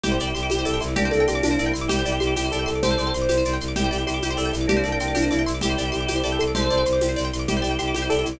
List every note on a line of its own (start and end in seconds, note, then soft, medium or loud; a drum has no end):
0.03 0.17 C2 loud
0.03 0.82 E4 medium
0.03 0.10 G4 loud
0.03 0.82 G4 medium
0.03 0.30 G4 medium
0.03 low conga loud
0.03 shaker medium
0.12 0.19 C5 medium
0.19 0.32 C2 loud
0.19 0.28 D5 medium
0.19 shaker medium
0.27 0.34 G5 medium
0.35 0.48 C2 medium
0.35 0.50 G4 medium
0.35 0.42 C6 medium
0.35 shaker medium
0.43 0.50 D6 medium
0.50 0.64 C2 medium
0.50 0.64 G4 medium
0.50 0.58 G4 medium
0.50 high conga loud
0.50 shaker medium
0.59 0.66 C5 medium
0.65 0.79 C2 medium
0.65 0.79 A4 medium
0.65 0.72 D5 medium
0.65 tambourine medium
0.65 shaker medium
0.74 0.81 G5 medium
0.81 0.95 C2 loud
0.81 0.94 E4 medium
0.81 0.88 C6 medium
0.81 shaker medium
0.88 0.95 D6 medium
0.96 1.10 C2 loud
0.96 1.72 A#3 medium
0.96 1.72 D4 medium
0.96 1.03 G4 loud
0.96 1.11 G4 medium
0.96 low conga loud
0.96 shaker medium
1.05 1.12 C5 medium
1.11 1.26 C2 medium
1.11 1.25 A4 medium
1.11 1.18 D5 medium
1.11 shaker medium
1.20 1.27 G5 medium
1.28 1.41 C2 medium
1.28 1.43 G4 medium
1.28 1.35 C6 medium
1.28 shaker medium
1.35 1.42 D6 medium
1.43 1.57 C2 loud
1.43 1.59 D4 medium
1.43 1.50 G4 medium
1.43 tambourine medium
1.43 high conga loud
1.43 shaker loud
1.51 1.58 C5 medium
1.59 1.72 C2 loud
1.59 1.88 E4 medium
1.59 1.66 D5 medium
1.59 shaker medium
1.66 1.73 G5 medium
1.74 1.88 C2 medium
1.74 1.81 C6 medium
1.74 shaker medium
1.81 1.88 D6 medium
1.88 2.03 C2 loud
1.88 2.71 E4 medium
1.88 2.71 G4 medium
1.88 1.96 G4 loud
1.88 2.16 G4 medium
1.88 low conga loud
1.88 shaker loud
1.99 2.06 C5 medium
2.05 2.19 C2 loud
2.05 2.13 D5 medium
2.05 shaker medium
2.12 2.19 G5 medium
2.20 2.34 C2 loud
2.20 2.34 G4 medium
2.20 2.27 C6 medium
2.20 shaker medium
2.27 2.34 D6 medium
2.36 2.50 C2 medium
2.36 2.49 G4 medium
2.36 2.44 G4 medium
2.36 tambourine medium
2.36 high conga medium
2.36 shaker medium
2.45 2.52 C5 medium
2.52 2.65 C2 loud
2.52 2.66 A4 medium
2.52 2.60 D5 medium
2.52 shaker medium
2.59 2.66 G5 medium
2.66 2.81 C2 medium
2.66 2.81 A4 medium
2.66 2.73 C6 medium
2.66 shaker medium
2.75 2.82 D6 medium
2.83 2.96 C2 loud
2.83 2.90 G4 medium
2.83 3.13 A4 medium
2.83 3.55 C5 medium
2.83 3.13 C5 medium
2.83 low conga loud
2.83 shaker medium
2.91 2.98 C5 medium
2.98 3.12 C2 loud
2.98 3.05 D5 medium
2.98 shaker medium
3.07 3.14 G5 medium
3.14 3.27 C2 loud
3.14 3.21 C6 medium
3.14 shaker medium
3.22 3.29 D6 medium
3.29 3.43 C2 loud
3.29 3.36 G4 medium
3.29 tambourine loud
3.29 high conga loud
3.29 shaker medium
3.37 3.45 C5 medium
3.45 3.58 C2 loud
3.45 3.53 D5 medium
3.45 shaker medium
3.53 3.60 G5 medium
3.60 3.74 C2 loud
3.60 3.68 C6 medium
3.60 shaker medium
3.68 3.75 D6 medium
3.76 3.89 C2 loud
3.76 4.55 E4 medium
3.76 4.02 G4 medium
3.76 3.83 G4 loud
3.76 4.55 G4 medium
3.76 low conga loud
3.76 shaker medium
3.84 3.91 C5 medium
3.91 4.05 C2 loud
3.91 3.98 D5 medium
3.91 shaker medium
3.98 4.05 G5 medium
4.07 4.20 C2 medium
4.07 4.22 G4 medium
4.07 4.14 C6 medium
4.07 shaker medium
4.14 4.21 D6 medium
4.22 4.36 C2 medium
4.22 4.37 G4 medium
4.22 4.30 G4 medium
4.22 high conga loud
4.22 shaker medium
4.30 4.37 C5 medium
4.37 4.51 C2 medium
4.37 4.51 A4 medium
4.37 4.44 D5 medium
4.37 tambourine medium
4.37 shaker medium
4.45 4.52 G5 medium
4.53 4.67 C2 loud
4.53 4.66 E4 medium
4.53 4.60 C6 medium
4.53 shaker medium
4.61 4.68 D6 medium
4.67 4.82 C2 loud
4.67 5.43 A#3 medium
4.67 5.43 D4 medium
4.67 4.83 G4 medium
4.67 4.76 G4 loud
4.67 low conga loud
4.67 shaker medium
4.77 4.84 C5 medium
4.84 4.98 C2 medium
4.84 4.98 A4 medium
4.84 4.91 D5 medium
4.84 shaker medium
4.92 4.99 G5 medium
5.00 5.13 C2 medium
5.00 5.16 G4 medium
5.00 5.07 C6 medium
5.00 shaker medium
5.08 5.15 D6 medium
5.15 5.29 C2 loud
5.15 5.31 D4 medium
5.15 5.22 G4 medium
5.15 tambourine medium
5.15 high conga loud
5.15 shaker loud
5.22 5.29 C5 medium
5.31 5.44 C2 loud
5.31 5.61 E4 medium
5.31 5.38 D5 medium
5.31 shaker medium
5.39 5.46 G5 medium
5.46 5.60 C2 medium
5.46 5.53 C6 medium
5.46 shaker medium
5.54 5.61 D6 medium
5.61 5.75 C2 loud
5.61 6.44 E4 medium
5.61 6.44 G4 medium
5.61 5.69 G4 loud
5.61 5.89 G4 medium
5.61 low conga loud
5.61 shaker loud
5.69 5.76 C5 medium
5.77 5.91 C2 loud
5.77 5.85 D5 medium
5.77 shaker medium
5.85 5.92 G5 medium
5.92 6.06 C2 loud
5.92 6.06 G4 medium
5.92 5.99 C6 medium
5.92 shaker medium
6.01 6.08 D6 medium
6.08 6.22 C2 medium
6.08 6.15 G4 medium
6.08 6.22 G4 medium
6.08 tambourine medium
6.08 high conga medium
6.08 shaker medium
6.16 6.23 C5 medium
6.24 6.37 C2 loud
6.24 6.38 A4 medium
6.24 6.31 D5 medium
6.24 shaker medium
6.32 6.39 G5 medium
6.39 6.53 C2 medium
6.39 6.52 A4 medium
6.39 6.48 C6 medium
6.39 shaker medium
6.48 6.55 D6 medium
6.54 6.68 C2 loud
6.54 6.63 G4 medium
6.54 6.84 A4 medium
6.54 6.84 C5 medium
6.54 7.28 C5 medium
6.54 low conga loud
6.54 shaker medium
6.62 6.69 C5 medium
6.70 6.84 C2 loud
6.70 6.77 D5 medium
6.70 shaker medium
6.78 6.85 G5 medium
6.85 6.99 C2 loud
6.85 6.93 C6 medium
6.85 shaker medium
6.93 7.00 D6 medium
7.01 7.15 C2 loud
7.01 7.09 G4 medium
7.01 tambourine loud
7.01 high conga loud
7.01 shaker medium
7.09 7.16 C5 medium
7.16 7.30 C2 loud
7.16 7.23 D5 medium
7.16 shaker medium
7.25 7.32 G5 medium
7.32 7.46 C2 loud
7.32 7.41 C6 medium
7.32 shaker medium
7.39 7.46 D6 medium
7.48 7.61 C2 loud
7.48 8.28 E4 medium
7.48 7.55 G4 loud
7.48 7.74 G4 medium
7.48 8.28 G4 medium
7.48 low conga loud
7.48 shaker medium
7.57 7.64 C5 medium
7.62 7.77 C2 loud
7.62 7.69 D5 medium
7.62 shaker medium
7.71 7.78 G5 medium
7.79 7.92 C2 medium
7.79 7.94 G4 medium
7.79 7.86 C6 medium
7.79 shaker medium
7.88 7.95 D6 medium
7.95 8.08 C2 medium
7.95 8.08 G4 medium
7.95 8.03 G4 medium
7.95 high conga loud
7.95 shaker medium
8.02 8.09 C5 medium
8.10 8.23 C2 medium
8.10 8.23 A4 medium
8.10 8.17 D5 medium
8.10 tambourine medium
8.10 shaker medium
8.19 8.26 G5 medium
8.25 8.39 C2 loud
8.25 8.39 E4 medium
8.25 8.33 C6 medium
8.25 shaker medium
8.33 8.39 D6 medium